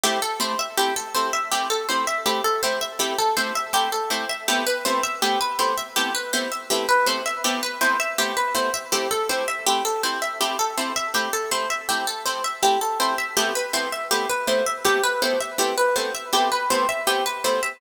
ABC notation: X:1
M:3/4
L:1/16
Q:1/4=81
K:Am
V:1 name="Orchestral Harp"
G A c e G A c e G A c e | G A c e G A c e G A c e | G B c e G B c e G B c e | G B c e G B c e G B c e |
G A c e G A c e G A c e | G A c e G A c e G A c e | G B c e G B c e G B c e | G B c e G B c e G B c e |]
V:2 name="Orchestral Harp"
[A,CE]2 [A,CEG]2 [A,CE]2 [A,CEG]2 [A,CE]2 [A,CEG]2 | [A,CE]2 [A,CEG]2 [A,CE]2 [A,CEG]2 [A,CE]2 [A,CEG]2 | [A,B,CE]2 [A,B,CEG]2 [A,B,CE]2 [A,B,CEG]2 [A,B,CE]2 [A,B,CEG]2 | [A,B,CE]2 [A,B,CEG]2 [A,B,CE]2 [A,B,CEG]2 [A,B,CE]2 [A,B,CEG]2 |
[A,CE]2 [A,CEG]2 [A,CE]2 [A,CEG]2 [A,CE]2 [A,CEG]2 | [A,CE]2 [A,CEG]2 [A,CE]2 [A,CEG]2 [A,CE]2 [A,CEG]2 | [A,B,CE]2 [A,B,CEG]2 [A,B,CE]2 [A,B,CEG]2 [A,B,CE]2 [A,B,CEG]2 | [A,B,CE]2 [A,B,CEG]2 [A,B,CE]2 [A,B,CEG]2 [A,B,CE]2 [A,B,CEG]2 |]